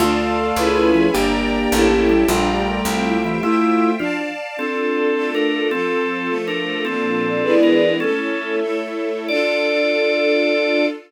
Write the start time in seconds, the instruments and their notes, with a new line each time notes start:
0.00 electric bass (finger) D2, drawbar organ A3, acoustic grand piano A3 F4, string ensemble 1 D4 D5 F5 A5
0.18 string ensemble 1 F4
0.37 string ensemble 1 A4
0.56 electric bass (finger) C#2, string ensemble 1 C#4 E4 G#4 B4 C#5 E5 G#5 B5
0.94 drawbar organ F3
1.14 electric bass (finger) G1, acoustic grand piano A#3 G4, string ensemble 1 D4 D5 G5 A#5, drawbar organ D4
1.33 string ensemble 1 G4
1.54 string ensemble 1 A#4
1.72 electric bass (finger) A1, string ensemble 1 C#4 E4 G4 A4 C#5 E5 G5 A5
2.09 drawbar organ G3
2.28 electric bass (finger) A#1, drawbar organ G3, acoustic grand piano A3 F4, string ensemble 1 D4 D5 G5 A#5
2.48 string ensemble 1 G4
2.66 string ensemble 1 A#4
2.85 electric bass (finger) C2, string ensemble 1 C4 C5 E5 G5
3.04 string ensemble 1 E4
3.24 drawbar organ E3, string ensemble 1 G4
3.43 acoustic grand piano A3 F4, drawbar organ E4, string ensemble 1 C5 E5 G5
3.99 acoustic grand piano F3 D4, drawbar organ F4, string ensemble 1 D5 F5 A5
4.57 drawbar organ C4 A4, string ensemble 1 D4 F4 A4
4.76 string ensemble 1 F4
4.95 string ensemble 1 A4
5.15 string ensemble 1 A3 D4 F4 A4
5.33 string ensemble 1 D4, drawbar organ D4 A#4
5.52 string ensemble 1 F4
5.71 string ensemble 1 F3 C4 F4 A4, drawbar organ C4 A4
5.90 string ensemble 1 A4
6.10 string ensemble 1 C5
6.27 string ensemble 1 F3 A3 A4
6.48 drawbar organ D4 A#4, string ensemble 1 F4
6.67 string ensemble 1 A4
6.85 string ensemble 1 A#2 F3 A#3 D4, drawbar organ C4 A4
7.04 string ensemble 1 F4
7.24 string ensemble 1 D5
7.42 string ensemble 1 E3 G#3 B3 D4 E4 G#4 B4 D5
7.63 drawbar organ A#4
8.00 string ensemble 1 A3 C#4 E4 A4, drawbar organ C#4 A4
8.19 string ensemble 1 C#5
8.40 string ensemble 1 E5
8.60 string ensemble 1 A3 E4 A4 C#5
8.82 string ensemble 1 A4
9.05 string ensemble 1 C#5
9.28 string ensemble 1 D4 F4 A4, drawbar organ D5